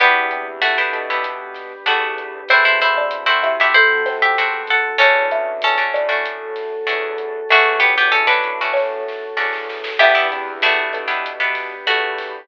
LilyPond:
<<
  \new Staff \with { instrumentName = "Acoustic Guitar (steel)" } { \time 4/4 \key e \minor \tempo 4 = 96 <b g'>4 <a fis'>2 <a fis'>4 | <e' c''>16 <e' c''>16 <e' c''>8. <e' c''>8 <g' e''>16 <e' c''>8. <g' e''>8. <a' fis''>8 | <cis' a'>4 <cis' a'>2 r4 | <a fis'>8 <b g'>16 <b g'>16 <cis' a'>16 <d' b'>4.~ <d' b'>16 r4 |
<b g'>8 r8 <a fis'>2 <a fis'>4 | }
  \new Staff \with { instrumentName = "Xylophone" } { \time 4/4 \key e \minor <e e'>8 <c c'>4 <d d'>2~ <d d'>8 | <c' c''>8. <d' d''>8. <e' e''>8 <a a'>8 <c' c''>4 r8 | <cis' cis''>8 <e' e''>4 <d' d''>2~ <d' d''>8 | <a a'>2 <cis' cis''>8 r4. |
<e' e''>8 <c c'>4 <d d'>4~ <d d'>16 r4 r16 | }
  \new Staff \with { instrumentName = "Acoustic Guitar (steel)" } { \time 4/4 \key e \minor <b d' e' g'>4~ <b d' e' g'>16 <b d' e' g'>8 <b d' e' g'>4~ <b d' e' g'>16 <b d' e' g'>4 | <a c' e' fis'>4~ <a c' e' fis'>16 <a c' e' fis'>8 <a c' e' fis'>4~ <a c' e' fis'>16 <a c' e' fis'>4 | <a cis' d' fis'>4~ <a cis' d' fis'>16 <a cis' d' fis'>8 <a cis' d' fis'>4~ <a cis' d' fis'>16 <a cis' d' fis'>4 | <a cis' d' fis'>4~ <a cis' d' fis'>16 <a cis' d' fis'>8 <a cis' d' fis'>4~ <a cis' d' fis'>16 <a cis' d' fis'>4 |
<b d' e' g'>16 <b d' e' g'>8. <b d' e' g'>8. <b d' e' g'>8 <b d' e' g'>4.~ <b d' e' g'>16 | }
  \new Staff \with { instrumentName = "Synth Bass 1" } { \clef bass \time 4/4 \key e \minor e,4. b,4. e,4 | e,4. c4. e,4 | e,4. a,4. e,4 | e,4. a,4. e,4 |
e,4. b,4. e,4 | }
  \new Staff \with { instrumentName = "Pad 5 (bowed)" } { \time 4/4 \key e \minor <b d' e' g'>2 <b d' g' b'>2 | <a c' e' fis'>2 <a c' fis' a'>2 | <a cis' d' fis'>2 <a cis' fis' a'>2 | <a cis' d' fis'>2 <a cis' fis' a'>2 |
<b d' e' g'>2 <b d' g' b'>2 | }
  \new DrumStaff \with { instrumentName = "Drums" } \drummode { \time 4/4 <hh bd ss>8 hh8 hh8 <hh bd ss>8 <hh bd>8 <hh sn>8 <hh ss>8 <hh bd>8 | <hh bd>8 hh8 <hh ss>8 <hh bd>8 <hh bd>8 <hh sn>8 hh8 <hh bd>8 | <hh bd ss>8 hh8 hh8 <hh bd ss>8 <hh bd>8 <hh sn>8 <hh ss>8 <hh bd>8 | <hh bd>8 hh8 <hh ss>8 <hh bd>8 <bd sn>8 sn8 sn16 sn16 sn16 sn16 |
<cymc bd ss>8 hh8 hh8 <hh bd ss>8 <hh bd>8 <hh sn>8 <hh ss>8 <hho bd>8 | }
>>